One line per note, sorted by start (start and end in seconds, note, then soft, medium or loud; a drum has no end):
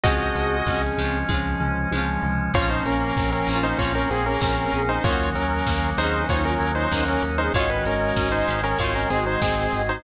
0.04 0.31 C#2 medium
0.04 2.52 F3 medium
0.04 0.97 F3 loud
0.04 2.52 G#3 medium
0.04 0.91 G#3 loud
0.04 0.58 C4 loud
0.04 2.52 C#4 medium
0.04 0.91 C#4 loud
0.04 0.82 F#4 medium
0.04 0.58 G#4 loud
0.04 0.82 D#5 medium
0.04 kick loud
0.04 closed hi-hat loud
0.10 0.91 F4 loud
0.35 0.62 C#2 medium
0.35 1.29 G#3 medium
0.35 open hi-hat medium
0.66 0.93 C#2 medium
0.66 1.18 C4 medium
0.66 1.60 C#4 medium
0.66 1.18 G#4 loud
0.66 kick medium
0.66 snare loud
0.98 1.24 C#2 medium
0.98 1.91 F3 medium
0.98 1.27 G#3 medium
0.98 1.27 C#4 loud
0.98 open hi-hat medium
1.04 1.27 F4 medium
1.29 1.56 C#2 medium
1.29 1.89 F3 medium
1.29 1.86 G#3 loud
1.29 2.22 G#3 medium
1.29 1.89 C#4 medium
1.29 1.86 C#4 medium
1.29 kick medium
1.29 high tom medium
1.34 1.86 F4 medium
1.60 1.87 C#2 medium
1.60 2.49 C#4 medium
1.60 floor tom medium
1.92 2.18 C#2 medium
1.92 2.51 F3 medium
1.92 2.50 G#3 medium
1.92 2.50 C#4 medium
1.92 high tom medium
1.98 2.50 F4 medium
2.22 2.49 C#2 medium
2.22 2.52 G#3 medium
2.22 floor tom loud
2.53 2.81 A#1 medium
2.53 2.85 F3 loud
2.53 5.02 F3 medium
2.53 3.66 F3 medium
2.53 3.40 A#3 loud
2.53 5.02 A#3 medium
2.53 5.02 C4 medium
2.53 3.40 C4 loud
2.53 5.02 C#4 medium
2.53 3.66 C#4 loud
2.53 2.70 F4 medium
2.53 2.70 C#5 medium
2.53 kick loud
2.53 crash loud
2.59 3.40 C#4 loud
2.59 3.40 F4 loud
2.69 2.84 D#4 medium
2.69 2.84 C5 medium
2.85 3.12 A#1 medium
2.85 3.16 A#3 medium
2.85 3.30 C#4 medium
2.85 3.30 A#4 medium
2.85 open hi-hat medium
3.17 3.43 A#1 medium
3.17 3.48 C4 medium
3.17 kick loud
3.17 snare loud
3.32 3.59 C#4 medium
3.32 3.59 A#4 medium
3.46 3.74 A#1 medium
3.46 3.76 A#3 loud
3.46 3.76 C4 medium
3.46 3.78 C#4 medium
3.46 open hi-hat medium
3.53 3.76 C#4 medium
3.53 3.76 F4 loud
3.63 3.78 D#4 medium
3.63 3.78 C5 medium
3.78 4.06 A#1 medium
3.78 4.08 F3 medium
3.78 4.11 F3 medium
3.78 4.37 A#3 medium
3.78 4.37 C4 loud
3.78 4.08 C#4 loud
3.78 3.93 F4 medium
3.78 3.93 C#5 medium
3.78 kick medium
3.78 closed hi-hat loud
3.85 4.37 C#4 loud
3.85 4.37 F4 medium
3.95 4.10 C#4 medium
3.95 4.10 A#4 medium
4.10 4.37 A#1 medium
4.10 4.42 A#3 medium
4.10 4.25 C4 medium
4.10 4.70 C4 medium
4.10 4.25 G#4 medium
4.10 4.70 G#4 medium
4.10 open hi-hat medium
4.26 4.41 C#4 medium
4.26 4.41 A#4 medium
4.41 4.68 A#1 medium
4.41 4.98 A#3 medium
4.41 4.73 C4 medium
4.41 4.98 C4 medium
4.41 4.83 C#4 medium
4.41 4.83 A#4 medium
4.41 kick medium
4.41 snare loud
4.46 4.98 C#4 medium
4.46 4.98 F4 medium
4.73 4.99 A#1 medium
4.73 4.98 C4 medium
4.73 5.03 C#4 medium
4.73 4.98 G#4 loud
4.73 open hi-hat medium
4.89 5.04 D#4 medium
4.89 5.04 C5 medium
5.04 5.31 D#2 loud
5.04 7.51 D#3 medium
5.04 5.36 D#3 loud
5.04 7.51 F#3 medium
5.04 7.51 A#3 medium
5.04 5.91 A#3 loud
5.04 7.51 C#4 medium
5.04 5.34 C#4 medium
5.04 5.91 C#4 loud
5.04 5.30 F4 medium
5.04 5.34 A#4 loud
5.04 5.30 C#5 medium
5.04 kick loud
5.04 closed hi-hat loud
5.10 5.91 D#4 loud
5.10 5.91 F#4 loud
5.35 5.62 D#2 medium
5.35 5.66 F#3 medium
5.35 5.90 C#4 medium
5.35 5.90 A#4 medium
5.35 open hi-hat medium
5.66 5.93 D#2 medium
5.66 5.98 A#3 medium
5.66 kick medium
5.66 snare loud
5.97 6.24 D#2 medium
5.97 6.27 A#3 loud
5.97 6.23 C4 medium
5.97 6.28 C#4 medium
5.97 6.26 D#4 medium
5.97 6.23 G#4 loud
5.97 6.26 C5 medium
5.97 open hi-hat medium
6.01 6.27 C#4 medium
6.01 6.27 D#4 loud
6.06 6.27 F#4 medium
6.28 6.56 D#2 medium
6.28 6.59 D#3 medium
6.28 6.86 A#3 medium
6.28 6.86 C#4 medium
6.28 6.44 D#4 medium
6.28 6.44 F4 medium
6.28 6.44 C5 loud
6.28 6.44 C#5 medium
6.28 kick loud
6.28 closed hi-hat loud
6.34 6.86 D#4 medium
6.34 6.86 F#4 medium
6.45 6.72 C#4 medium
6.45 6.89 F4 medium
6.45 6.72 A#4 medium
6.45 6.89 C#5 loud
6.60 6.87 D#2 medium
6.60 6.91 F#3 medium
6.60 open hi-hat medium
6.75 7.04 D#4 medium
6.75 7.04 C5 medium
6.91 7.18 D#2 medium
6.91 7.23 A#3 medium
6.91 7.50 A#3 loud
6.91 7.30 C#4 medium
6.91 7.50 C#4 medium
6.91 7.30 A#4 loud
6.91 kick medium
6.91 snare loud
6.98 7.50 D#4 medium
6.98 7.50 F#4 medium
7.08 7.23 C#4 medium
7.08 7.23 A#4 medium
7.22 7.49 D#2 medium
7.22 7.52 C#4 medium
7.22 open hi-hat medium
7.38 7.53 C4 medium
7.38 7.53 D#4 medium
7.38 7.53 G#4 medium
7.38 7.53 C5 medium
7.54 7.80 G#1 medium
7.54 7.85 D#3 loud
7.54 8.78 D#3 medium
7.54 8.78 G#3 medium
7.54 8.41 G#3 loud
7.54 8.78 C#4 medium
7.54 8.41 C#4 loud
7.54 7.70 F4 medium
7.54 8.59 F#4 loud
7.54 7.70 C#5 medium
7.54 8.59 D#5 loud
7.54 kick loud
7.54 closed hi-hat loud
7.60 8.41 D#4 loud
7.70 7.84 B4 medium
7.85 8.12 G#1 medium
7.85 8.18 G#3 medium
7.85 8.29 C#4 medium
7.85 8.29 A#4 medium
7.85 open hi-hat medium
8.16 8.43 G#1 medium
8.16 8.48 C#4 medium
8.16 kick medium
8.16 snare loud
8.32 8.61 D#4 medium
8.32 8.61 C5 medium
8.48 8.74 G#1 medium
8.48 8.79 D#3 medium
8.48 8.76 G#3 medium
8.48 8.76 C#4 loud
8.48 open hi-hat medium
8.53 8.76 D#4 medium
8.64 8.78 C#4 medium
8.64 8.78 A#4 medium
8.79 9.06 G#1 loud
8.79 10.03 D#3 medium
8.79 9.10 D#3 loud
8.79 9.36 G#3 loud
8.79 10.03 G#3 medium
8.79 10.03 C4 medium
8.79 9.36 C4 loud
8.79 8.94 F4 medium
8.79 9.07 F#4 medium
8.79 8.94 C#5 medium
8.79 9.07 D#5 medium
8.79 kick medium
8.79 closed hi-hat loud
8.84 9.36 D#4 loud
8.95 9.10 C#4 medium
8.95 9.10 A#4 medium
9.10 9.37 G#1 medium
9.10 9.42 G#3 medium
9.10 9.25 C4 medium
9.10 9.67 F#4 medium
9.10 9.25 G#4 medium
9.10 9.67 D#5 loud
9.10 open hi-hat medium
9.26 9.41 D#4 medium
9.26 9.41 C5 medium
9.41 9.68 G#1 medium
9.41 9.99 G#3 medium
9.41 9.73 C4 medium
9.41 9.82 C4 medium
9.41 9.99 C4 loud
9.41 9.82 G#4 medium
9.41 kick medium
9.41 snare loud
9.47 9.99 D#4 medium
9.73 9.99 G#1 medium
9.73 10.03 D#3 medium
9.73 9.98 F#4 medium
9.73 9.98 D#5 loud
9.73 open hi-hat medium
9.89 10.03 D#4 medium
9.89 10.03 C5 medium